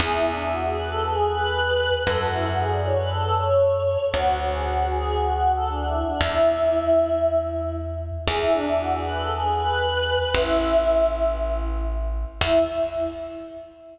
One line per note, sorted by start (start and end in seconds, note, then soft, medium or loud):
0.00 1.90 E2 medium
0.00 0.12 G#4 medium
0.13 0.25 E4 medium
0.27 0.39 D4 medium
0.38 0.51 E4 medium
0.53 0.65 F#4 medium
0.64 0.76 G#4 medium
0.78 0.90 B4 medium
0.90 1.03 A4 medium
1.04 1.26 G#4 medium
1.29 1.94 B4 medium
2.07 3.97 F#2 medium
2.07 2.20 A4 medium
2.19 2.31 F#4 medium
2.32 2.44 E4 medium
2.46 2.58 F#4 medium
2.58 2.70 G#4 medium
2.71 2.84 D5 medium
2.85 2.97 C#5 medium
2.98 3.10 B4 medium
3.09 3.34 A4 medium
3.37 4.06 C#5 medium
4.14 6.04 D2 medium
4.14 4.37 F#4 medium
4.53 4.65 G#4 medium
4.65 4.86 F#4 medium
4.91 5.15 G#4 medium
5.17 5.51 F#4 medium
5.56 5.68 A4 medium
5.69 5.85 D4 medium
5.86 6.02 E4 medium
6.04 6.20 D4 medium
6.20 8.11 E2 medium
6.20 7.18 E4 medium
8.27 10.18 E2 medium
8.27 8.40 G#4 medium
8.41 8.53 E4 medium
8.53 8.66 D4 medium
8.66 8.79 E4 medium
8.79 8.92 F#4 medium
8.92 9.04 G#4 medium
9.05 9.18 B4 medium
9.18 9.30 A4 medium
9.31 9.55 G#4 medium
9.56 10.30 B4 medium
10.34 12.25 A1 medium
10.34 11.06 E4 medium
12.41 12.59 E2 loud
12.41 12.59 E4 loud